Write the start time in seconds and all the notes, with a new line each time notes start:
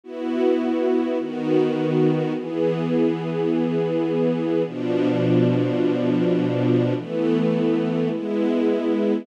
0.04 B3 E4 F#4
1.19 D#3 B3 F#4
2.34 E3 B3 G#4
4.65 B2 F3 D4
6.95 E3 A3 B3
8.11 G#3 B3 E4